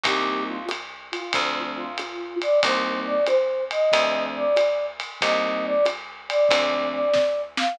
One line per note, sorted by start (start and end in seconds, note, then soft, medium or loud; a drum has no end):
0.03 1.15 C2 loud
0.03 0.57 G3 medium
0.03 0.57 A#3 medium
0.03 0.57 C4 medium
0.03 0.57 D#4 loud
0.03 0.43 G4 loud
0.03 kick medium
0.03 ride medium
0.47 0.65 F4 loud
0.69 hi-hat pedal medium
0.69 ride medium
1.12 1.60 F4 loud
1.12 ride medium
1.33 2.47 D2 loud
1.33 1.85 F3 medium
1.33 1.85 A3 medium
1.33 1.85 C4 medium
1.33 1.85 D4 medium
1.33 kick medium
1.33 ride medium
1.76 2.36 F4 loud
1.98 hi-hat pedal medium
1.98 ride medium
2.42 2.60 D5 loud
2.42 ride medium
2.63 3.75 C2 loud
2.63 3.15 G3 medium
2.63 3.15 A#3 medium
2.63 3.15 C4 medium
2.63 3.15 D#4 medium
2.63 3.00 C5 loud
2.63 kick medium
2.63 ride medium
3.06 3.24 D5 loud
3.26 3.64 C5 loud
3.26 hi-hat pedal medium
3.26 ride medium
3.71 4.22 D#5 loud
3.71 ride medium
3.92 5.05 D2 loud
3.92 4.44 F3 medium
3.92 4.44 A3 medium
3.92 4.44 C4 medium
3.92 4.44 D4 medium
3.92 kick medium
3.92 ride medium
4.36 4.86 D5 loud
4.56 hi-hat pedal medium
4.56 ride medium
5.00 ride medium
5.21 6.34 C2 loud
5.21 5.74 G3 medium
5.21 5.74 A#3 medium
5.21 5.74 C4 medium
5.21 5.74 D#4 medium
5.21 5.63 D#5 loud
5.21 kick medium
5.21 ride medium
5.65 5.85 D5 loud
5.85 hi-hat pedal medium
5.85 ride medium
6.29 6.88 D5 loud
6.29 ride medium
6.49 7.62 D2 loud
6.49 7.02 F3 medium
6.49 7.02 A3 medium
6.49 7.02 C4 medium
6.49 7.02 D4 medium
6.49 kick medium
6.49 ride loud
6.93 7.42 D5 medium
7.14 kick medium
7.14 snare medium
7.57 7.77 F5 loud
7.57 snare medium